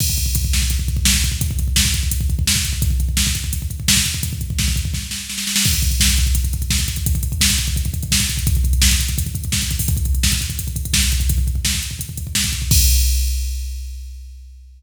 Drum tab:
CC |x---------------|----------------|----------------|----------------|
HH |--x-x---x-x---x-|x-x---x-x-x---x-|x-x---x-x-x---x-|x-x---x---------|
SD |------o-----o---|----o-------o---|----o-------o---|----o---o-o-oooo|
BD |oooooooooooooooo|oooooooooooooooo|oooooooooooooooo|ooooooooo-------|

CC |x---------------|----------------|----------------|----------------|
HH |-xxx-xxxxxxx-xxx|xxxx-xxxxxxx-xxx|xxxx-xxxxxxx-xxo|xxxx-xxxxxxx-xxx|
SD |----o-------o---|----o-------o---|----o-------o---|----o-------o---|
BD |oooooooooooooooo|oooooooooooooooo|oooooooooooooooo|oooooooooooooooo|

CC |----------------|x---------------|
HH |x-x---x-x-x---x-|----------------|
SD |----o-------o---|----------------|
BD |oooooo-ooooooooo|o---------------|